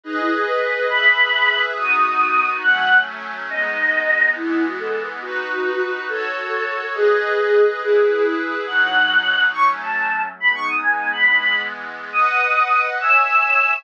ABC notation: X:1
M:6/8
L:1/8
Q:3/8=139
K:Bmix
V:1 name="Choir Aahs"
D E G B3 | b6 | d'6 | f3 z3 |
d6 | E2 F A2 z | F6 | A6 |
G6 | G3 E2 G | f6 | c' z a3 z |
b c' d' g2 b | b3 z3 | d'6 | e'6 |]
V:2 name="Pad 5 (bowed)"
[GBd]6 | [GBe]6 | [B,DF]6 | [F,A,C]6 |
[G,B,D]6 | [E,G,B,]6 | [DFB]6 | [FAc]6 |
[GBd]6 | [EGB]6 | [B,,F,D]6 | [F,A,C]6 |
[G,B,D]6 | [E,G,B,]6 | [Bdf]6 | [ceg]6 |]